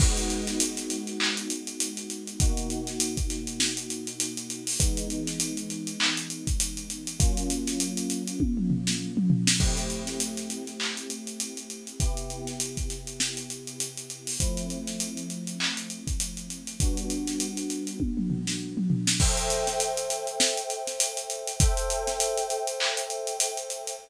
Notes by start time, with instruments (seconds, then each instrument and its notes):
0.00 electric piano 1 G#3 B3 D#4 F#4, kick, crash
0.17 snare, closed hi-hat
0.30 closed hi-hat
0.47 snare, closed hi-hat
0.60 closed hi-hat
0.77 snare, closed hi-hat
0.90 closed hi-hat
1.07 snare, closed hi-hat
1.20 clap
1.37 closed hi-hat
1.50 closed hi-hat
1.67 closed hi-hat
1.80 closed hi-hat
1.97 closed hi-hat
2.10 closed hi-hat
2.27 closed hi-hat
2.40 electric piano 1 B2 A#3 D#4 F#4, kick, closed hi-hat
2.57 closed hi-hat
2.70 closed hi-hat
2.87 snare, closed hi-hat
3.00 closed hi-hat
3.17 kick, closed hi-hat
3.30 snare, closed hi-hat
3.47 closed hi-hat
3.60 snare
3.77 closed hi-hat
3.90 closed hi-hat
4.07 closed hi-hat
4.20 closed hi-hat
4.37 closed hi-hat
4.50 closed hi-hat
4.67 open hi-hat
4.80 electric piano 1 E3 G#3 B3 D#4, kick, closed hi-hat
4.97 closed hi-hat
5.10 closed hi-hat
5.27 snare, closed hi-hat
5.40 closed hi-hat
5.57 closed hi-hat
5.70 closed hi-hat
5.87 closed hi-hat
6.00 clap
6.17 closed hi-hat
6.30 closed hi-hat
6.47 kick, closed hi-hat
6.60 closed hi-hat
6.77 closed hi-hat
6.90 closed hi-hat
7.07 closed hi-hat
7.20 electric piano 1 F#3 A#3 C#4 F4, kick, closed hi-hat
7.37 closed hi-hat
7.50 closed hi-hat
7.67 snare, closed hi-hat
7.80 closed hi-hat
7.97 closed hi-hat
8.10 closed hi-hat
8.28 closed hi-hat
8.40 kick, high tom
8.57 mid tom
8.70 floor tom
8.87 snare
9.17 mid tom
9.30 floor tom
9.47 snare
9.60 electric piano 1 A3 C4 E4 G4, kick, crash
9.77 snare, closed hi-hat
9.90 closed hi-hat
10.07 snare, closed hi-hat
10.20 closed hi-hat
10.37 snare, closed hi-hat
10.50 closed hi-hat
10.67 snare, closed hi-hat
10.80 clap
10.97 closed hi-hat
11.10 closed hi-hat
11.27 closed hi-hat
11.40 closed hi-hat
11.57 closed hi-hat
11.70 closed hi-hat
11.87 closed hi-hat
12.00 electric piano 1 C3 B3 E4 G4, kick, closed hi-hat
12.17 closed hi-hat
12.30 closed hi-hat
12.47 snare, closed hi-hat
12.60 closed hi-hat
12.77 kick, closed hi-hat
12.90 snare, closed hi-hat
13.07 closed hi-hat
13.20 snare
13.37 closed hi-hat
13.50 closed hi-hat
13.67 closed hi-hat
13.80 closed hi-hat
13.97 closed hi-hat
14.10 closed hi-hat
14.27 open hi-hat
14.40 electric piano 1 F3 A3 C4 E4, kick, closed hi-hat
14.57 closed hi-hat
14.70 closed hi-hat
14.87 snare, closed hi-hat
15.00 closed hi-hat
15.17 closed hi-hat
15.30 closed hi-hat
15.47 closed hi-hat
15.60 clap
15.77 closed hi-hat
15.90 closed hi-hat
16.07 kick, closed hi-hat
16.20 closed hi-hat
16.37 closed hi-hat
16.50 closed hi-hat
16.67 closed hi-hat
16.80 electric piano 1 G3 B3 D4 F#4, kick, closed hi-hat
16.97 closed hi-hat
17.10 closed hi-hat
17.27 snare, closed hi-hat
17.40 closed hi-hat
17.57 closed hi-hat
17.70 closed hi-hat
17.87 closed hi-hat
18.00 kick, high tom
18.17 mid tom
18.30 floor tom
18.47 snare
18.77 mid tom
18.90 floor tom
19.07 snare
19.20 electric piano 1 A4 C5 E5 G5, kick, crash
19.37 closed hi-hat
19.50 closed hi-hat
19.67 snare, closed hi-hat
19.80 closed hi-hat
19.97 closed hi-hat
20.10 closed hi-hat
20.27 closed hi-hat
20.40 snare
20.57 closed hi-hat
20.70 closed hi-hat
20.87 snare, closed hi-hat
21.00 closed hi-hat
21.17 closed hi-hat
21.30 closed hi-hat
21.47 closed hi-hat
21.60 electric piano 1 A4 C5 E5 G5, kick, closed hi-hat
21.77 closed hi-hat
21.90 closed hi-hat
22.07 snare, closed hi-hat
22.20 closed hi-hat
22.37 closed hi-hat
22.50 closed hi-hat
22.67 closed hi-hat
22.80 clap
22.97 closed hi-hat
23.10 closed hi-hat
23.27 closed hi-hat
23.40 closed hi-hat
23.57 closed hi-hat
23.70 closed hi-hat
23.87 closed hi-hat